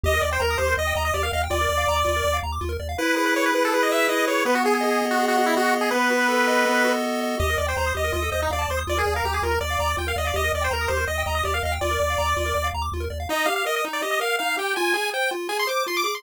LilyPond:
<<
  \new Staff \with { instrumentName = "Lead 1 (square)" } { \time 4/4 \key ees \major \tempo 4 = 163 ees''8 d''16 c''16 bes'8 c''8 ees''8 ees''16 ees''16 d''16 f''16 f''16 r16 | d''2~ d''8 r4. | \key e \major b'8 b'16 b'16 cis''16 b'16 b'16 a'16 b'16 dis''16 e''8 dis''8 cis''8 | b'16 fis'16 gis'16 gis'16 gis'8. fis'8 fis'16 fis'16 e'16 fis'8 r16 gis'16 |
b'2. r4 | \key ees \major ees''8 d''16 c''16 c''8 ees''8 ees''8 ees''16 ees'16 d''16 d''16 c''16 r16 | d''16 aes'8 bes'16 g'16 aes'16 bes'8 d''4 g''16 f''16 ees''16 d''16 | ees''8 d''16 c''16 bes'8 c''8 ees''8 ees''16 ees''16 d''16 f''16 f''16 r16 |
d''2~ d''8 r4. | ees''8 f''16 f''16 ees''16 ees''16 r16 d''16 ees''16 ees''16 f''8 f''8 g''8 | aes''8 aes''8 g''8 r8 aes''16 c'''16 d'''8 c'''16 d'''16 d'''16 c'''16 | }
  \new Staff \with { instrumentName = "Lead 1 (square)" } { \time 4/4 \key ees \major g'16 bes'16 ees''16 g''16 bes''16 ees'''16 g'16 bes'16 ees''16 g''16 bes''16 ees'''16 g'16 bes'16 ees''16 g''16 | f'16 bes'16 d''16 f''16 bes''16 d'''16 f'16 bes'16 d''16 f''16 bes''16 d'''16 f'16 bes'16 d''16 f''16 | \key e \major e'8 gis'8 b'8 e'8 gis'8 b'8 e'8 gis'8 | b8 gis'8 dis''8 b8 gis'8 dis''8 b8 gis'8 |
b8 fis'8 a'8 dis''8 b8 fis'8 a'8 dis''8 | \key ees \major g'16 bes'16 ees''16 g''16 bes''16 ees'''16 g'16 bes'16 f'16 a'16 c''16 ees''16 f''16 a''16 c'''16 ees'''16 | f'16 bes'16 d''16 f''16 bes''16 d'''16 f'16 bes'16 d''16 f''16 bes''16 d'''16 f'16 bes'16 d''16 f''16 | g'16 bes'16 ees''16 g''16 bes''16 ees'''16 g'16 bes'16 ees''16 g''16 bes''16 ees'''16 g'16 bes'16 ees''16 g''16 |
f'16 bes'16 d''16 f''16 bes''16 d'''16 f'16 bes'16 d''16 f''16 bes''16 d'''16 f'16 bes'16 d''16 f''16 | ees'8 g'8 bes'8 ees'8 g'8 bes'8 ees'8 g'8 | f'8 aes'8 c''8 f'8 aes'8 c''8 f'8 aes'8 | }
  \new Staff \with { instrumentName = "Synth Bass 1" } { \clef bass \time 4/4 \key ees \major ees,8 ees,8 ees,8 ees,8 ees,8 ees,8 ees,8 ees,8 | ees,8 ees,8 ees,8 ees,8 ees,8 ees,8 ees,8 ees,8 | \key e \major r1 | r1 |
r1 | \key ees \major ees,8 ees,8 ees,8 ees,8 ees,8 ees,8 ees,8 ees,8 | ees,8 ees,8 ees,8 ees,8 ees,8 ees,8 ees,8 ees,8 | ees,8 ees,8 ees,8 ees,8 ees,8 ees,8 ees,8 ees,8 |
ees,8 ees,8 ees,8 ees,8 ees,8 ees,8 ees,8 ees,8 | r1 | r1 | }
>>